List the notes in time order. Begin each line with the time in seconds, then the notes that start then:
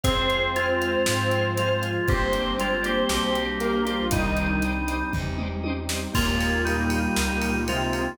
0.03 F2 G#3 C4 F4 G#4 C5 F5, kick, closed hi-hat
0.08 G#4
0.29 C5 F5, closed hi-hat
0.33 G#4
0.56 G#3 F4 C5 F5, closed hi-hat
0.60 G#4
0.81 C5 F5, closed hi-hat
0.85 G#4
1.06 G#2 F3 G#3 F4 C5 F5, snare
1.11 G#4
1.31 C5 F5, closed hi-hat
1.37 G#4
1.57 G#3 F4 C5 F5, closed hi-hat
1.63 G#4
1.81 C5 F5, closed hi-hat
1.86 G#4
2.08 G1 G3 A#3 C4 D4 G4 C5 D5, kick, closed hi-hat
2.12 G4 C5
2.33 C5 D5, closed hi-hat
2.37 G4
2.58 G#3 F4 C5 D5, closed hi-hat
2.62 G4
2.83 A#3 G4 C5 D5, closed hi-hat
2.87 G4
3.09 B1 G3 A#3 D4 G4 C5 D5, snare
3.13 G4
3.35 C5 D5, closed hi-hat
3.41 G4
3.60 A#3 A#4 C5 D5, closed hi-hat
3.65 G4
3.85 F3 A#3 F4 G4 C5 D5, closed hi-hat
3.90 G4
4.11 C2 D#3 G3 C4 D4 D#4 D5 D#5, kick, closed hi-hat
4.17 G4 C5
4.37 D5 D#5, closed hi-hat
4.41 G4 C5
4.62 D5 D#5, closed hi-hat
4.67 G4 C5
4.86 D5 D#5, closed hi-hat
4.90 G4 C5
5.12 E2 G3 C4 D#4 G4 D5 D#5, kick, floor tom
5.16 G4 C5
5.38 D5 D#5, mid tom
5.42 G4 C5
5.63 D5 D#5, high tom
5.68 G4 C5
5.89 D5 D#5, snare
5.94 G4 C5
6.13 D#2 A#2 G#3 A#3 D#4 F4 G4, kick, crash
6.18 A#3 D#4
6.40 F4 G4, ride
6.44 A#3 D#4
6.65 A#2 G3 A#3 D#4 F4 G4, ride
6.70 A#3 D#4
6.90 F4 G4, ride
6.96 A#3 D#4
7.16 C#2 F4 G4, snare
7.20 A#3 D#4
7.41 F4 G4, ride
7.45 A#3 D#4
7.67 C3 G#3 C4 F4 G4, ride
7.71 A#3 D#4
7.92 F4 G4, ride
7.96 A#3 D#4